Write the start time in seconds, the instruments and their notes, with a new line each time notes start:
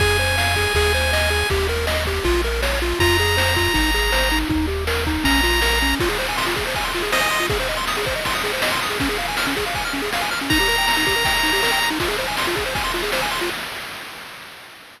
0.00 synth bass 1 F2, lead 1 (square) G#4 G#5, kick, crash
0.18 lead 1 (square) C5, ride
0.38 lead 1 (square) F5, snare
0.55 lead 1 (square) G#4, kick, ride
0.75 synth bass 1 D#2, lead 1 (square) G#4, kick, ride
0.94 lead 1 (square) C5, ride
1.13 lead 1 (square) D#5, snare
1.30 lead 1 (square) G#4, ride
1.49 synth bass 1 D#2, lead 1 (square) G4, kick, ride
1.69 lead 1 (square) A#4, ride
1.87 lead 1 (square) D#5, snare
2.06 lead 1 (square) G4, kick, ride
2.24 synth bass 1 A#1, lead 1 (square) F4, kick, ride
2.44 lead 1 (square) A#4, ride
2.62 lead 1 (square) C#5, snare
2.81 lead 1 (square) F4, ride
3.00 synth bass 1 F2, lead 1 (square) F4 A#5, kick, ride
3.18 lead 1 (square) G#4, ride
3.37 lead 1 (square) C5, snare
3.56 lead 1 (square) F4, kick, ride
3.74 synth bass 1 G#1, lead 1 (square) D#4, kick, ride
3.94 lead 1 (square) G#4, ride
4.12 lead 1 (square) C5, snare
4.31 lead 1 (square) D#4, ride
4.49 synth bass 1 D#2, lead 1 (square) D#4, kick
4.68 lead 1 (square) G4, ride
4.87 lead 1 (square) A#4, snare
5.06 lead 1 (square) D#4, kick, ride
5.24 synth bass 1 A#1, lead 1 (square) C#4 A#5, kick, ride
5.43 lead 1 (square) F4, ride
5.61 lead 1 (square) A#4, snare
5.81 lead 1 (square) C#4, ride
6.00 lead 1 (square) F4, kick, crash
6.09 lead 1 (square) G#4, ride
6.19 lead 1 (square) C5, ride
6.28 lead 1 (square) G#5, ride
6.37 lead 1 (square) C6, snare
6.46 lead 1 (square) F4, ride
6.56 lead 1 (square) G#4, kick, ride
6.66 lead 1 (square) C5, ride
6.74 lead 1 (square) G#5, kick, ride
6.84 lead 1 (square) C6, ride
6.94 lead 1 (square) F4, ride
7.02 lead 1 (square) G#4, ride
7.12 lead 1 (square) C5 D#5, snare
7.21 lead 1 (square) G#5, ride
7.31 lead 1 (square) C6, ride
7.40 lead 1 (square) F4, ride
7.50 lead 1 (square) G#4, kick, ride
7.60 lead 1 (square) C5, ride
7.68 lead 1 (square) D#5, ride
7.77 lead 1 (square) C6, ride
7.87 lead 1 (square) D#6, snare
7.97 lead 1 (square) G#4, ride
8.06 lead 1 (square) C5, kick, ride
8.16 lead 1 (square) D#5, ride
8.25 lead 1 (square) C6, kick, ride
8.34 lead 1 (square) D#6, ride
8.44 lead 1 (square) G#4, ride
8.53 lead 1 (square) C5, ride
8.62 lead 1 (square) D#5, snare
8.72 lead 1 (square) C6, ride
8.82 lead 1 (square) D#6, ride
8.90 lead 1 (square) G#4, ride
9.00 lead 1 (square) C#4, kick, ride
9.09 lead 1 (square) G#4, ride
9.18 lead 1 (square) F5, ride
9.28 lead 1 (square) G#5, ride
9.37 lead 1 (square) F6, snare
9.46 lead 1 (square) C#4, ride
9.56 lead 1 (square) G#4, kick, ride
9.65 lead 1 (square) F5, ride
9.74 lead 1 (square) G#5, kick, ride
9.84 lead 1 (square) F6, ride
9.93 lead 1 (square) C#4, ride
10.02 lead 1 (square) G#4, ride
10.13 lead 1 (square) F5, snare
10.21 lead 1 (square) G#5, ride
10.31 lead 1 (square) F6, ride
10.40 lead 1 (square) C#4, ride
10.50 lead 1 (square) D#4 A#5, kick, ride
10.59 lead 1 (square) G4, ride
10.68 lead 1 (square) A#4, ride
10.78 lead 1 (square) G5, ride
10.87 lead 1 (square) A#5, snare
10.96 lead 1 (square) D#4, ride
11.07 lead 1 (square) G4, kick, ride
11.16 lead 1 (square) A#4, ride
11.25 lead 1 (square) G5, kick, ride
11.35 lead 1 (square) A#5, ride
11.43 lead 1 (square) D#4, ride
11.52 lead 1 (square) G4, ride
11.63 lead 1 (square) A#4, snare
11.71 lead 1 (square) G5, ride
11.81 lead 1 (square) A#5, ride
11.90 lead 1 (square) D#4, ride
12.00 lead 1 (square) F4, kick, ride
12.08 lead 1 (square) G#4, ride
12.18 lead 1 (square) C5, ride
12.28 lead 1 (square) G#5, ride
12.37 lead 1 (square) C6, snare
12.47 lead 1 (square) F4, ride
12.56 lead 1 (square) G#4, kick, ride
12.66 lead 1 (square) C5, ride
12.75 lead 1 (square) G#5, kick, ride
12.84 lead 1 (square) C6, ride
12.94 lead 1 (square) F4, ride
13.03 lead 1 (square) G#4, ride
13.12 lead 1 (square) C5, snare
13.21 lead 1 (square) G#5, ride
13.31 lead 1 (square) C6, ride
13.41 lead 1 (square) F4, ride